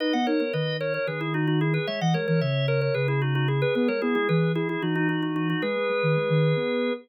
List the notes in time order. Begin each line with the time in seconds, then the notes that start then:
0.00 D#4 B4 D#5
0.13 B3 D#5 F#5
0.27 D#4 A#4 C#5
0.40 B3 A#4 C#5
0.53 D#3 B4 D#5
0.80 A#4 C#5
0.94 A#4 C#5
1.07 D#3 G#4 B4
1.21 E4 G#4
1.34 D#4 F#4
1.47 D#4 F#4
1.61 E4 G#4
1.74 G#4 B4
1.87 G#3 C#5 E5
2.01 E3 D#5 F#5
2.14 G#3 A#4 C#5
2.28 E3 A#4 C#5
2.41 C#3 C#5 E5
2.68 A#4 C#5
2.81 A#4 C#5
2.94 C#3 G#4 B4
3.08 E4 G#4
3.22 D#4 F#4
3.35 D#4 F#4
3.48 E4 G#4
3.62 G#4 B4
3.75 B3 G#4 B4
3.88 G#3 A#4 C#5
4.02 B3 E4 G#4
4.15 G#3 E4 G#4
4.29 E3 G#4 B4
4.55 E4 G#4
4.69 E4 G#4
4.82 E3 D#4 F#4
4.95 D#4 F#4
5.09 D#4 F#4
5.22 D#4 F#4
5.36 D#4 F#4
5.50 D#4 F#4
5.62 G#3 G#4 B4
5.76 G#3
5.89 G#3
6.03 D#3
6.16 G#3
6.29 D#3
6.56 B3